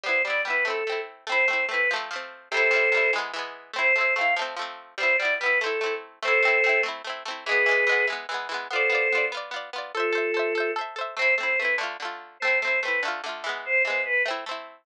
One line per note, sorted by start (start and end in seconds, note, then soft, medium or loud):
0.04 0.22 G3 medium
0.04 0.22 B3 medium
0.04 0.22 C5 medium
0.09 0.22 E4 medium
0.25 0.44 G3 medium
0.25 0.44 B3 medium
0.25 0.41 D5 medium
0.30 0.44 E4 medium
0.45 0.64 G3 medium
0.45 0.64 B3 medium
0.45 0.65 B4 medium
0.50 0.64 E4 medium
0.65 0.84 A3 medium
0.65 0.84 C4 medium
0.65 1.00 A4 medium
0.70 0.84 E4 medium
0.87 1.25 A3 medium
0.87 1.25 C4 medium
0.92 1.25 E4 medium
1.27 1.46 A3 loud
1.27 1.46 C4 medium
1.27 1.47 C5 medium
1.32 1.46 E4 loud
1.48 1.67 A3 medium
1.48 1.67 C4 medium
1.48 1.65 C5 medium
1.53 1.67 E4 medium
1.69 1.88 A3 medium
1.69 1.88 C4 medium
1.69 1.90 B4 medium
1.74 1.88 E4 medium
1.91 2.10 F3 loud
1.91 2.10 A3 loud
1.96 2.10 C4 loud
2.11 2.49 F3 medium
2.11 2.49 A3 medium
2.16 2.49 C4 medium
2.51 2.70 C3 loud
2.51 2.71 G3 medium
2.51 3.12 A4 medium
2.51 3.12 C5 medium
2.57 2.71 E4 loud
2.71 2.90 C3 medium
2.71 2.90 G3 medium
2.76 2.90 E4 medium
2.92 3.11 C3 medium
2.92 3.11 G3 medium
2.97 3.11 E4 medium
3.13 3.32 E3 medium
3.13 3.32 G#3 loud
3.18 3.32 B3 loud
3.34 3.71 E3 loud
3.34 3.71 G#3 medium
3.39 3.71 B3 medium
3.73 3.92 A3 medium
3.73 3.92 C4 loud
3.73 3.95 C5 medium
3.79 3.92 E4 loud
3.95 4.15 A3 medium
3.95 4.15 C4 medium
3.95 4.14 C5 medium
4.01 4.15 E4 medium
4.16 4.35 A3 medium
4.16 4.35 C4 medium
4.16 4.34 F5 medium
4.21 4.35 E4 medium
4.36 4.55 F3 loud
4.36 4.55 A3 medium
4.41 4.55 C4 loud
4.56 4.94 F3 medium
4.56 4.94 A3 medium
4.62 4.94 C4 medium
4.98 5.17 G3 loud
4.98 5.17 B3 medium
4.98 5.16 C5 medium
5.03 5.17 E4 loud
5.17 5.38 G3 medium
5.17 5.34 D5 medium
5.22 5.38 B3 medium
5.22 5.38 E4 medium
5.39 5.60 G3 medium
5.39 5.60 B3 medium
5.39 5.59 B4 medium
5.46 5.60 E4 medium
5.59 5.80 A3 loud
5.59 5.94 A4 medium
5.64 5.80 C4 loud
5.64 5.80 E4 medium
5.81 6.19 A3 medium
5.81 6.19 C4 medium
5.86 6.19 E4 medium
6.23 6.41 A3 loud
6.23 6.41 C4 loud
6.23 6.81 A4 medium
6.23 6.81 C5 medium
6.28 6.41 E4 loud
6.43 6.62 A3 medium
6.43 6.62 C4 loud
6.48 6.62 E4 medium
6.64 6.83 A3 medium
6.64 6.83 C4 medium
6.69 6.83 E4 medium
6.83 7.02 A3 medium
6.83 7.02 C4 medium
6.88 7.02 E4 medium
7.04 7.23 A3 medium
7.04 7.23 C4 medium
7.10 7.23 E4 medium
7.25 7.44 A3 medium
7.25 7.44 C4 medium
7.31 7.44 E4 medium
7.45 7.65 E3 medium
7.45 7.65 G#3 loud
7.45 8.06 G#4 medium
7.45 8.06 B4 medium
7.51 7.65 B3 loud
7.66 7.85 E3 medium
7.66 7.85 G#3 medium
7.71 7.85 B3 medium
7.87 8.06 E3 medium
7.87 8.06 G#3 medium
7.92 8.06 B3 medium
8.07 8.26 E3 medium
8.07 8.26 G#3 medium
8.12 8.26 B3 medium
8.29 8.48 E3 medium
8.29 8.48 G#3 medium
8.34 8.48 B3 medium
8.49 8.68 E3 medium
8.49 8.68 G#3 medium
8.54 8.68 B3 medium
8.71 8.89 B3 medium
8.71 8.89 F4 loud
8.71 9.25 A4 medium
8.71 9.25 C5 medium
8.76 8.89 D5 loud
8.90 9.09 B3 medium
8.90 9.09 F4 medium
8.95 9.09 D5 medium
9.12 9.31 B3 medium
9.12 9.31 F4 loud
9.18 9.31 D5 medium
9.32 9.51 B3 medium
9.32 9.51 F4 medium
9.37 9.51 D5 loud
9.51 9.70 B3 medium
9.51 9.70 F4 medium
9.56 9.70 D5 medium
9.73 9.92 B3 medium
9.73 9.92 F4 medium
9.78 9.92 D5 medium
9.94 10.71 F4 medium
9.94 10.71 A4 medium
9.94 10.12 A4 medium
9.94 10.14 C5 loud
10.00 10.14 E5 loud
10.13 10.32 A4 medium
10.13 10.32 C5 medium
10.18 10.32 E5 medium
10.34 10.53 A4 medium
10.34 10.53 C5 medium
10.39 10.53 E5 medium
10.55 10.74 A4 medium
10.55 10.74 C5 medium
10.60 10.74 E5 medium
10.76 10.95 A4 medium
10.76 10.95 C5 medium
10.81 10.95 E5 medium
10.96 11.15 A4 medium
10.96 11.15 C5 medium
11.01 11.15 E5 medium
11.17 11.36 A3 medium
11.17 11.36 C4 loud
11.17 11.34 C5 medium
11.22 11.36 E4 loud
11.38 11.57 A3 medium
11.38 11.57 C4 medium
11.38 11.59 C5 medium
11.43 11.57 E4 medium
11.58 11.78 A3 medium
11.58 11.75 B4 medium
11.62 11.78 C4 medium
11.62 11.78 E4 medium
11.78 11.97 D3 loud
11.78 11.97 A3 loud
11.83 11.97 F4 loud
12.00 12.38 D3 medium
12.00 12.38 A3 medium
12.05 12.38 F4 medium
12.40 12.61 A3 loud
12.40 12.58 C5 medium
12.45 12.61 C4 medium
12.45 12.61 E4 medium
12.61 12.81 A3 medium
12.61 12.79 C5 medium
12.65 12.81 C4 medium
12.65 12.81 E4 medium
12.82 13.02 A3 medium
12.82 13.02 C4 medium
12.82 13.01 B4 medium
12.88 13.02 E4 medium
13.03 13.22 D3 medium
13.03 13.22 A3 medium
13.08 13.22 F4 medium
13.24 13.43 D3 medium
13.24 13.43 A3 medium
13.29 13.43 F4 medium
13.44 13.83 E3 loud
13.44 13.83 G#3 medium
13.49 13.83 B3 medium
13.65 13.82 C5 medium
13.85 14.23 E3 medium
13.85 14.23 G#3 medium
13.85 14.02 C5 medium
13.90 14.23 B3 medium
14.05 14.22 B4 medium
14.26 14.45 A3 medium
14.26 14.45 C4 loud
14.31 14.45 E4 loud
14.46 14.84 A3 medium
14.46 14.84 C4 medium
14.51 14.84 E4 medium